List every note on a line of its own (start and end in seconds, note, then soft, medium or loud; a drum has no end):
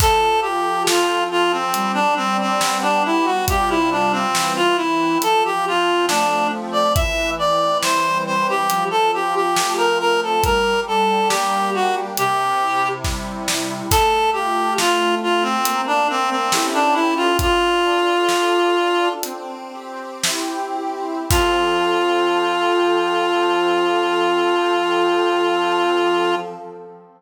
0.00 1.65 F3 loud
0.00 0.40 A4 loud
0.00 kick loud
0.00 crash loud
0.41 0.83 G4 medium
0.41 1.30 A4 medium
0.87 1.70 C4 medium
0.87 1.24 F4 medium
0.87 snare loud
1.30 1.52 F4 loud
1.30 1.72 A4 medium
1.52 1.92 C4 medium
1.74 3.39 G3 loud
1.74 closed hi-hat loud
1.94 2.14 D4 medium
2.16 2.37 C4 loud
2.16 3.04 D4 medium
2.41 2.78 C4 medium
2.61 3.43 B3 medium
2.61 snare loud
2.82 3.03 D4 medium
3.04 3.46 D4 medium
3.04 3.26 E4 medium
3.25 3.45 F#4 medium
3.48 4.26 C3 loud
3.48 4.26 G3 medium
3.48 4.26 F4 loud
3.48 3.70 G4 loud
3.48 kick loud
3.48 closed hi-hat loud
3.69 3.90 E4 medium
3.91 4.12 D4 medium
4.12 4.53 C4 loud
4.35 5.17 E3 medium
4.35 snare loud
4.56 4.77 F4 loud
4.76 5.20 C4 medium
4.76 5.18 E4 medium
5.22 6.87 F3 loud
5.22 5.43 A4 loud
5.22 closed hi-hat loud
5.45 5.65 G4 loud
5.65 6.52 C4 medium
5.65 6.06 F4 medium
6.08 6.91 A3 medium
6.08 6.47 D4 loud
6.08 snare loud
6.52 6.93 C4 medium
6.72 6.93 D5 medium
6.95 8.61 E3 medium
6.95 7.30 E5 loud
6.95 kick loud
6.95 closed hi-hat loud
7.39 8.26 C4 medium
7.39 7.78 D5 medium
7.83 8.65 G3 medium
7.83 8.18 C5 loud
7.83 snare loud
8.26 8.67 C4 medium
8.26 8.47 C5 medium
8.49 8.84 G4 medium
8.70 10.35 F3 loud
8.70 closed hi-hat loud
8.91 9.11 A4 medium
9.13 9.99 C4 medium
9.13 9.35 G4 medium
9.35 9.73 G4 medium
9.56 10.39 A3 medium
9.56 snare loud
9.77 9.98 A#4 medium
10.00 10.41 C4 medium
10.00 10.20 A#4 loud
10.23 10.44 A4 medium
10.43 12.09 G3 loud
10.43 10.80 A#4 loud
10.43 kick loud
10.43 closed hi-hat loud
10.87 11.73 D4 medium
10.87 11.28 A4 medium
11.29 12.13 A#3 medium
11.29 11.70 G4 loud
11.29 snare loud
11.74 12.15 D4 medium
11.74 11.95 F#4 medium
12.17 13.83 C3 loud
12.17 12.88 G4 loud
12.17 closed hi-hat loud
12.61 13.47 E4 medium
13.04 13.87 G3 medium
13.04 kick medium
13.04 snare medium
13.48 13.89 E4 medium
13.48 snare loud
13.91 15.57 A3 medium
13.91 14.30 A4 loud
13.91 kick loud
13.91 crash loud
14.33 15.21 F4 medium
14.33 14.74 G4 loud
14.78 15.61 C4 medium
14.78 15.15 F4 loud
14.78 snare loud
15.22 15.63 F4 medium
15.22 15.43 F4 medium
15.42 15.81 C4 loud
15.65 16.48 A#3 loud
15.65 closed hi-hat loud
15.87 16.08 D4 medium
16.09 16.30 C4 loud
16.09 16.50 D4 medium
16.30 16.66 C4 medium
16.52 17.30 C#4 loud
16.52 17.30 E4 medium
16.52 17.30 G4 loud
16.52 17.30 A4 medium
16.52 snare loud
16.74 16.95 D4 loud
16.93 17.14 E4 loud
17.16 17.37 F4 loud
17.39 19.13 D4 medium
17.39 19.09 F4 loud
17.39 kick loud
17.39 closed hi-hat loud
17.83 18.75 A4 medium
18.29 19.18 F4 medium
18.29 snare loud
18.75 19.21 A4 medium
19.23 21.20 C4 medium
19.23 closed hi-hat loud
19.72 20.76 G4 medium
20.24 21.25 E4 medium
20.24 snare loud
20.76 21.28 G4 medium
21.30 26.36 F3 loud
21.30 26.36 C4 loud
21.30 26.35 F4 loud
21.30 26.36 A4 loud
21.30 kick loud
21.30 crash loud